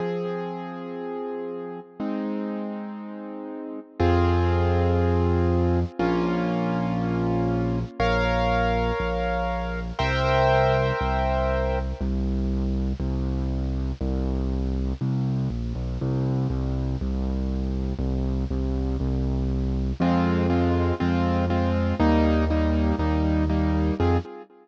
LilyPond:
<<
  \new Staff \with { instrumentName = "Acoustic Grand Piano" } { \time 4/4 \key f \minor \tempo 4 = 120 <f c' aes'>1 | <aes c' ees'>1 | <c' f' aes'>1 | <bes des' f'>1 |
<bes' des'' f''>1 | <bes' c'' e'' g''>1 | \key c \minor r1 | r1 |
r1 | r1 | \key f \minor <aes c' f'>4 <aes c' f'>4 <aes c' f'>4 <aes c' f'>4 | <g bes ees'>4 <g bes ees'>4 <g bes ees'>4 <g bes ees'>4 |
<c' f' aes'>4 r2. | }
  \new Staff \with { instrumentName = "Acoustic Grand Piano" } { \clef bass \time 4/4 \key f \minor r1 | r1 | f,1 | bes,,1 |
bes,,2 bes,,2 | c,2 c,2 | \key c \minor c,2 c,2 | c,2 c,4 bes,,8 b,,8 |
c,4 c,4 c,2 | c,4 c,4 c,2 | \key f \minor f,2 f,2 | ees,2 ees,2 |
f,4 r2. | }
>>